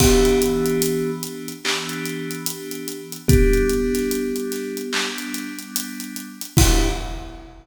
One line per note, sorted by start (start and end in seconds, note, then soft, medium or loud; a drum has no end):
0.00 1.51 E3 loud
0.00 1.51 B3 loud
0.00 1.11 B3 medium
0.00 1.51 D4 medium
0.00 1.51 G4 medium
0.00 1.11 G4 medium
0.00 kick medium
0.00 crash loud
0.25 closed hi-hat medium
0.42 closed hi-hat medium
0.66 closed hi-hat medium
0.82 closed hi-hat loud
1.23 closed hi-hat medium
1.48 closed hi-hat medium
1.64 3.16 E3 medium
1.64 3.16 B3 medium
1.64 3.16 D4 medium
1.64 3.16 G4 loud
1.64 clap loud
1.89 closed hi-hat medium
2.05 closed hi-hat medium
2.31 closed hi-hat medium
2.46 closed hi-hat loud
2.71 closed hi-hat medium
2.88 closed hi-hat medium
3.12 closed hi-hat medium
3.28 4.80 G3 loud
3.28 5.10 B3 medium
3.28 4.80 B3 loud
3.28 4.80 D4 loud
3.28 5.10 G4 medium
3.28 kick loud
3.28 closed hi-hat loud
3.53 closed hi-hat medium
3.70 closed hi-hat medium
3.94 snare soft
3.94 closed hi-hat medium
4.11 closed hi-hat medium
4.36 closed hi-hat medium
4.52 snare soft
4.52 closed hi-hat medium
4.77 closed hi-hat medium
4.93 6.45 G3 medium
4.93 6.45 B3 loud
4.93 6.45 D4 medium
4.93 clap loud
5.18 closed hi-hat medium
5.34 closed hi-hat medium
5.59 closed hi-hat medium
5.76 closed hi-hat loud
6.00 closed hi-hat medium
6.16 closed hi-hat medium
6.41 closed hi-hat medium
6.57 6.89 E3 loud
6.57 6.89 B3 loud
6.57 6.89 D4 loud
6.57 6.89 E4 loud
6.57 6.89 G4 loud
6.57 kick loud
6.57 crash loud